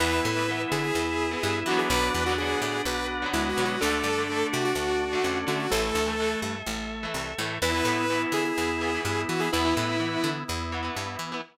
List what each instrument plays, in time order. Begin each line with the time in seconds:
0.00 electric bass (finger) E2, overdriven guitar E3 B3, drawbar organ B3 E4 B4 E5, lead 2 (sawtooth) B4
0.25 electric bass (finger) A2
0.37 overdriven guitar E3 B3
0.47 overdriven guitar E3 B3, drawbar organ B3 E4
0.72 electric bass (finger) D3, lead 2 (sawtooth) G#4
0.83 lead 2 (sawtooth) G#4
0.95 electric bass (finger) E2, drawbar organ B3 E4
1.31 overdriven guitar E3 B3
1.43 electric bass (finger) G2, drawbar organ B3 E4
1.66 overdriven guitar D3, electric bass (finger) E3, drawbar organ B3 D4 F#4, lead 2 (sawtooth) F#4
1.70 overdriven guitar F#3 B3
1.79 lead 2 (sawtooth) G#4
1.90 electric bass (finger) B1, drawbar organ D4 B4 D5 F#5, lead 2 (sawtooth) B4
2.14 electric bass (finger) E2
2.26 overdriven guitar D3 F#3, lead 2 (sawtooth) F#4
2.31 overdriven guitar B3
2.38 overdriven guitar D3 F#3, drawbar organ B3 D4 F#4, lead 2 (sawtooth) G#4
2.42 overdriven guitar B3
2.62 electric bass (finger) A2, lead 2 (sawtooth) G#4
2.85 electric bass (finger) B1, drawbar organ B3 D4 F#4 B4 F#5, lead 2 (sawtooth) B4
3.22 overdriven guitar D3 F#3 B3
3.33 electric bass (finger) D2, drawbar organ G#3 B3 D4 F#4, lead 2 (sawtooth) E4
3.49 lead 2 (sawtooth) F#4
3.56 electric bass (finger) B2, overdriven guitar D3 F#3 B3
3.65 lead 2 (sawtooth) F#4
3.81 electric bass (finger) D2, overdriven guitar D3 A3, drawbar organ A3 D4 A4 D5, lead 2 (sawtooth) A4
4.04 electric bass (finger) G2
4.18 overdriven guitar D3 A3
4.29 overdriven guitar D3 A3, drawbar organ A3 D4
4.53 electric bass (finger) C3, lead 2 (sawtooth) F#4
4.65 lead 2 (sawtooth) F#4
4.75 electric bass (finger) D2, drawbar organ A3 D4
5.13 overdriven guitar D3 A3
5.24 electric bass (finger) F2, drawbar organ A3 C#4 D4
5.47 overdriven guitar D3 A3, electric bass (finger) D3, lead 2 (sawtooth) F#4
5.59 lead 2 (sawtooth) F#4
5.70 electric bass (finger) A1, overdriven guitar E3 A3, drawbar organ A3 A4 E5, lead 2 (sawtooth) A4
5.95 electric bass (finger) D2
6.06 overdriven guitar E3 A3
6.20 overdriven guitar E3 A3
6.42 electric bass (finger) G2
6.66 electric bass (finger) A1, drawbar organ A3
7.03 overdriven guitar E3 A3
7.14 electric bass (finger) C2
7.38 electric bass (finger) A2, overdriven guitar E3 A3
7.62 electric bass (finger) E2, overdriven guitar E3 B3, drawbar organ B3 E4, lead 2 (sawtooth) B4
7.74 overdriven guitar E3 B3
7.85 electric bass (finger) A2, overdriven guitar E3 B3
8.10 overdriven guitar E3 B3, drawbar organ B3 E4
8.32 electric bass (finger) D3, lead 2 (sawtooth) G#4
8.45 lead 2 (sawtooth) G#4
8.58 electric bass (finger) E2, drawbar organ B3 E4
8.81 overdriven guitar E3 B3
8.94 overdriven guitar E3 B3
9.05 electric bass (finger) G2, drawbar organ B3 E4
9.29 electric bass (finger) E3, lead 2 (sawtooth) F#4
9.40 overdriven guitar E3 B3, lead 2 (sawtooth) G#4
9.52 electric bass (finger) E2, overdriven guitar E3 B3, drawbar organ B3 E4 B4, lead 2 (sawtooth) E4
9.65 overdriven guitar E3 B3
9.77 electric bass (finger) A2, overdriven guitar E3 B3
10.00 overdriven guitar E3 B3, drawbar organ B3 E4
10.24 electric bass (finger) D3
10.48 electric bass (finger) E2, drawbar organ B3 E4
10.72 overdriven guitar E3 B3
10.82 overdriven guitar E3 B3
10.95 electric bass (finger) G2, drawbar organ B3 E4
11.19 electric bass (finger) E3
11.32 overdriven guitar E3 B3